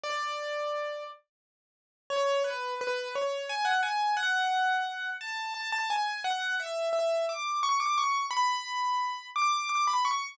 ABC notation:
X:1
M:6/8
L:1/16
Q:3/8=58
K:A
V:1 name="Acoustic Grand Piano"
d6 z6 | [K:F#m] c2 B2 B2 c2 g f g2 | f6 a2 a a g2 | f2 e2 e2 d'2 c' d' c'2 |
b6 d'2 d' b c'2 |]